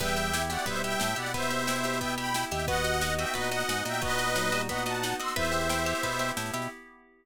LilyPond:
<<
  \new Staff \with { instrumentName = "Accordion" } { \time 4/4 \key e \minor \tempo 4 = 179 <e'' g''>4. <d'' fis''>8 <c'' e''>8 <e'' g''>4 <d'' fis''>8 | <c'' e''>2 <e'' g''>8 <g'' b''>4 <e'' g''>8 | <dis'' fis''>4. <e'' g''>8 <b' dis''>8 <dis'' fis''>4 <e'' g''>8 | <b' dis''>2 <dis'' fis''>8 <fis'' a''>4 <c''' e'''>8 |
<c'' e''>2. r4 | }
  \new Staff \with { instrumentName = "Electric Piano 2" } { \time 4/4 \key e \minor g4 g'8 fis'8 g4. r8 | b2. r4 | fis'4 dis''8 e''8 fis'4. r8 | fis'4 fis8 g8 fis'4. r8 |
e'2~ e'8 r4. | }
  \new Staff \with { instrumentName = "Acoustic Guitar (steel)" } { \time 4/4 \key e \minor b8 g'8 e'8 g'8 b8 g'8 e'8 g'8 | b8 g'8 e'8 g'8 b8 g'8 e'8 g'8 | b8 fis'8 dis'8 fis'8 b8 fis'8 dis'8 fis'8 | b8 fis'8 dis'8 fis'8 b8 fis'8 dis'8 fis'8 |
b8 g'8 e'8 g'8 b8 g'8 e'8 g'8 | }
  \new Staff \with { instrumentName = "Pizzicato Strings" } { \time 4/4 \key e \minor b'8 e''8 g''8 e''8 b'8 e''8 g''8 e''8 | b'8 e''8 g''8 e''8 b'8 e''8 g''8 e''8 | b'8 dis''8 fis''8 dis''8 b'8 dis''8 fis''8 dis''8 | b'8 dis''8 fis''8 dis''8 b'8 dis''8 fis''8 dis''8 |
b'8 e''8 g''8 e''8 b'8 e''8 g''8 e''8 | }
  \new Staff \with { instrumentName = "Drawbar Organ" } { \clef bass \time 4/4 \key e \minor e,2 b,4 a,8 b,8~ | b,2.~ b,8 dis,8~ | dis,2 ais,4 gis,8 ais,8~ | ais,1 |
e,2 b,4 a,8 b,8 | }
  \new Staff \with { instrumentName = "Pad 5 (bowed)" } { \time 4/4 \key e \minor <b e' g'>1~ | <b e' g'>1 | <b dis' fis'>1~ | <b dis' fis'>1 |
<b e' g'>1 | }
  \new DrumStaff \with { instrumentName = "Drums" } \drummode { \time 4/4 <cymc bd sn>16 sn16 sn16 sn16 sn16 sn16 sn16 sn16 <bd sn>16 sn16 sn16 sn16 sn16 sn16 sn16 sn16 | <bd sn>16 sn16 sn16 sn16 sn16 sn16 sn16 sn16 <bd sn>16 sn16 sn16 sn16 sn16 sn16 sn16 sn16 | <bd sn>16 sn16 sn16 sn16 sn16 sn16 sn16 sn16 <bd sn>16 sn16 sn16 sn16 sn16 sn16 sn16 sn16 | <bd sn>16 sn16 sn16 sn16 sn16 sn16 sn16 sn16 <bd sn>16 sn16 sn16 sn16 sn16 sn16 sn16 sn16 |
<bd sn>16 sn16 sn16 sn16 sn16 sn16 sn16 sn16 <bd sn>16 sn16 sn16 sn16 sn16 sn16 sn16 sn16 | }
>>